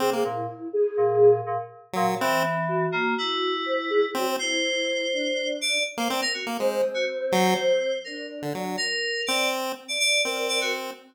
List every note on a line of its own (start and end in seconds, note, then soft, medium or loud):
0.00 0.22 C3 medium
0.00 0.10 C4 loud
0.00 0.22 G#4 medium
0.13 0.24 A#3 medium
0.24 0.46 A#2 medium
0.24 0.68 E4 medium
0.73 1.39 G#4 loud
0.97 1.41 A#2 medium
1.46 1.57 A#2 medium
1.93 2.06 A#2 loud
1.93 2.15 F#3 medium
2.07 2.18 A#2 medium
2.21 2.86 E3 loud
2.21 2.43 C4 loud
2.68 3.56 F#4 medium
2.92 3.14 A#3 loud
3.18 4.06 E4 medium
3.66 3.76 C5 medium
3.79 3.90 E4 medium
3.90 4.01 G#3 loud
4.15 4.26 F#3 medium
4.15 4.36 C4 loud
4.28 4.39 C4 medium
4.39 5.05 E4 loud
4.39 5.49 C5 medium
5.13 5.78 D4 medium
5.61 5.83 D5 loud
5.97 6.08 A#3 medium
5.97 6.09 C5 medium
6.09 6.21 C4 loud
6.09 6.20 D5 soft
6.22 6.33 A#4 loud
6.34 6.45 F#4 medium
6.47 6.58 A#3 medium
6.59 6.82 G#3 medium
6.59 7.90 C4 medium
6.94 7.05 F#4 medium
7.32 7.54 F#3 loud
7.32 7.98 C5 medium
8.04 8.50 D4 medium
8.04 8.26 A#4 medium
8.42 8.53 D3 medium
8.53 8.77 F#3 medium
8.53 8.75 D4 medium
8.77 9.21 A#4 loud
9.27 9.72 C4 medium
9.27 9.48 D5 medium
9.88 9.99 D5 medium
9.99 10.21 D5 loud
10.24 10.91 C4 medium
10.24 10.69 A#4 medium
10.24 10.46 D5 medium
10.48 10.59 D5 medium
10.61 10.72 F#4 medium